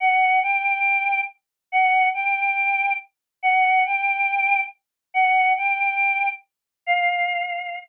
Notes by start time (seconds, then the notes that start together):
0.00 F#5
0.43 G5
1.72 F#5
2.14 G5
3.42 F#5
3.85 G5
5.14 F#5
5.57 G5
6.86 F5